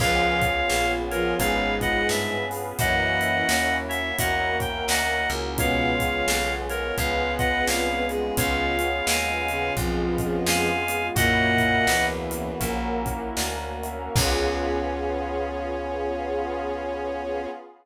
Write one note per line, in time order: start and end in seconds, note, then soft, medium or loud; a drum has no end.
0.00 0.64 C#2 medium
0.00 0.41 F3 medium
0.00 1.39 B3 medium
0.00 1.31 B3 loud
0.00 1.39 C#4 medium
0.00 1.31 C#4 loud
0.00 1.39 F4 medium
0.00 0.41 F4 loud
0.00 1.31 F4 loud
0.00 1.39 G#4 medium
0.00 1.31 G#4 loud
0.00 0.92 C#5 loud
0.00 0.92 F5 loud
0.00 kick medium
0.00 crash medium
0.42 kick medium
0.42 closed hi-hat medium
0.70 1.34 A#1 medium
0.70 snare medium
1.11 1.36 F3 medium
1.11 1.36 F4 medium
1.11 1.34 A#4 loud
1.11 1.34 C#5 loud
1.11 closed hi-hat medium
1.38 2.03 G#1 medium
1.38 2.35 G#2 medium
1.38 2.35 G#3 medium
1.38 1.77 B3 loud
1.38 2.78 B3 medium
1.38 1.77 C#4 medium
1.38 2.78 C#4 medium
1.38 1.77 F4 loud
1.38 1.77 G#4 loud
1.38 2.78 G#4 medium
1.38 2.78 B4 medium
1.38 1.74 C#5 loud
1.38 1.74 F5 loud
1.38 kick medium
1.38 closed hi-hat medium
1.80 2.43 B3 loud
1.80 2.43 C#4 medium
1.80 2.43 F4 medium
1.80 2.43 G#4 medium
1.80 2.07 D#5 loud
1.80 2.07 F#5 loud
1.80 kick medium
1.80 closed hi-hat medium
2.09 2.73 G2 medium
2.09 2.45 E5 loud
2.09 snare medium
2.51 2.76 B3 loud
2.51 2.76 C#4 loud
2.51 2.76 F4 medium
2.51 2.76 G#4 loud
2.51 open hi-hat medium
2.79 3.43 F#2 medium
2.79 3.45 E3 medium
2.79 4.17 A#3 medium
2.79 4.10 A#3 loud
2.79 4.17 C#4 medium
2.79 4.10 C#4 loud
2.79 4.17 E4 medium
2.79 4.10 E4 loud
2.79 3.45 E4 medium
2.79 4.17 F#4 medium
2.79 4.10 F#4 loud
2.79 3.76 D#5 loud
2.79 3.76 F#5 loud
2.79 kick medium
2.79 closed hi-hat medium
3.21 closed hi-hat medium
3.49 4.13 D#2 medium
3.49 snare loud
3.89 4.16 C#5 loud
3.89 4.16 E5 loud
3.89 closed hi-hat medium
4.18 4.83 E2 medium
4.18 4.57 A#3 loud
4.18 5.57 A#3 medium
4.18 4.57 C#4 loud
4.18 5.57 C#4 medium
4.18 4.57 E4 loud
4.18 4.57 F#4 loud
4.18 5.57 F#4 medium
4.18 5.57 A#4 medium
4.18 4.57 D#5 medium
4.18 4.57 F#5 loud
4.18 kick medium
4.18 closed hi-hat medium
4.59 5.22 A#3 loud
4.59 5.22 C#4 medium
4.59 5.22 E4 loud
4.59 5.22 F#4 loud
4.59 4.85 G5 loud
4.59 kick medium
4.59 closed hi-hat medium
4.88 5.27 D2 medium
4.88 5.29 D#5 loud
4.88 5.29 F#5 loud
4.88 snare loud
5.30 6.22 C#2 medium
5.30 5.57 A#3 loud
5.30 5.57 C#4 loud
5.30 5.57 E4 loud
5.30 5.57 F#4 medium
5.30 closed hi-hat medium
5.58 5.92 B2 medium
5.58 6.97 G#3 medium
5.58 6.89 G#3 loud
5.58 6.97 B3 medium
5.58 6.89 B3 loud
5.58 5.92 B3 loud
5.58 6.97 C#4 medium
5.58 6.89 C#4 loud
5.58 6.97 F4 medium
5.58 6.89 F4 loud
5.58 6.53 C#5 loud
5.58 6.53 F5 loud
5.58 kick medium
5.58 closed hi-hat medium
6.00 6.57 C#3 medium
6.00 6.57 C#4 medium
6.00 kick medium
6.00 closed hi-hat medium
6.28 6.92 B1 medium
6.28 snare loud
6.69 6.96 A#4 medium
6.69 6.96 C#5 loud
6.69 closed hi-hat medium
6.97 7.62 C#2 medium
6.97 8.36 G#3 medium
6.97 7.36 G#3 medium
6.97 8.36 B3 medium
6.97 8.04 B3 medium
6.97 7.36 B3 medium
6.97 7.36 C#4 medium
6.97 8.36 F4 medium
6.97 7.36 F4 medium
6.97 8.36 G#4 medium
6.97 8.04 B4 medium
6.97 7.32 C#5 medium
6.97 7.32 F5 loud
6.97 kick medium
6.97 closed hi-hat medium
7.39 8.03 G#3 medium
7.39 8.03 B3 loud
7.39 8.03 C#4 medium
7.39 8.03 F4 loud
7.39 7.65 D#5 loud
7.39 7.65 F#5 loud
7.39 kick medium
7.39 closed hi-hat medium
7.67 8.32 C2 medium
7.67 8.07 C#5 medium
7.67 8.07 F5 loud
7.67 snare loud
8.09 8.34 G#3 medium
8.09 8.35 G#3 medium
8.09 8.35 B3 loud
8.09 8.35 C#4 medium
8.09 8.35 F4 medium
8.09 8.34 G#4 medium
8.09 closed hi-hat medium
8.37 9.02 C#2 medium
8.37 8.77 C#3 medium
8.37 9.68 G#3 loud
8.37 9.76 G#3 medium
8.37 9.68 B3 loud
8.37 9.76 B3 medium
8.37 9.68 C#4 loud
8.37 9.76 C#4 medium
8.37 8.77 C#4 loud
8.37 9.68 F4 loud
8.37 9.76 F4 medium
8.37 9.06 C#5 loud
8.37 9.06 F5 loud
8.37 kick medium
8.37 closed hi-hat loud
8.79 closed hi-hat medium
9.07 9.71 D#2 medium
9.07 9.73 F5 medium
9.07 9.73 G#5 loud
9.07 snare loud
9.48 9.75 C#3 medium
9.48 9.75 C#4 medium
9.48 closed hi-hat medium
9.76 10.41 B1 medium
9.76 10.68 F2 medium
9.76 10.68 F3 medium
9.76 10.14 G#3 loud
9.76 11.15 G#3 loud
9.76 10.14 B3 medium
9.76 11.15 B3 medium
9.76 10.14 C#4 loud
9.76 10.14 F4 loud
9.76 11.15 F4 medium
9.76 11.15 G#4 medium
9.76 kick medium
9.76 closed hi-hat medium
10.18 10.82 G#3 medium
10.18 10.82 B3 medium
10.18 10.82 C#4 medium
10.18 10.82 F4 loud
10.18 kick medium
10.18 closed hi-hat medium
10.46 11.10 F2 medium
10.46 11.07 F5 loud
10.46 11.07 G#5 loud
10.46 snare loud
10.88 11.14 G#3 medium
10.88 11.14 B3 medium
10.88 11.14 C#4 loud
10.88 11.14 F4 medium
10.88 closed hi-hat medium
11.15 11.81 F#2 medium
11.15 11.85 A#2 medium
11.15 12.50 A#3 loud
11.15 12.60 A#3 medium
11.15 11.85 A#3 loud
11.15 12.50 C#4 loud
11.15 12.60 C#4 medium
11.15 12.50 E4 loud
11.15 12.60 E4 medium
11.15 12.50 F#4 loud
11.15 12.60 F#4 medium
11.15 12.05 D#5 loud
11.15 12.05 F#5 loud
11.15 kick medium
11.15 closed hi-hat medium
11.58 kick medium
11.58 closed hi-hat medium
11.87 12.55 C#2 medium
11.87 12.57 E2 medium
11.87 12.57 E3 medium
11.87 snare loud
12.31 closed hi-hat medium
12.60 13.31 A#1 medium
12.60 13.01 A#3 loud
12.60 14.14 A#3 medium
12.60 13.01 C#4 loud
12.60 14.14 C#4 medium
12.60 13.01 E4 medium
12.60 13.01 F#4 loud
12.60 14.14 F#4 medium
12.60 14.14 A#4 medium
12.60 kick medium
12.60 closed hi-hat medium
13.05 13.75 A#3 loud
13.05 13.75 C#4 medium
13.05 13.75 E4 medium
13.05 13.75 F#4 loud
13.05 kick medium
13.05 closed hi-hat medium
13.37 14.09 D2 medium
13.37 snare medium
13.83 14.13 A#3 medium
13.83 14.13 C#4 loud
13.83 14.13 E4 loud
13.83 14.13 F#4 medium
13.83 closed hi-hat medium
14.16 17.47 C#2 loud
14.16 17.47 B3 medium
14.16 17.47 C#4 loud
14.16 17.47 C#4 medium
14.16 17.47 F4 loud
14.16 17.47 F4 medium
14.16 17.47 G#4 loud
14.16 17.47 C#5 loud
14.16 kick loud
14.16 crash loud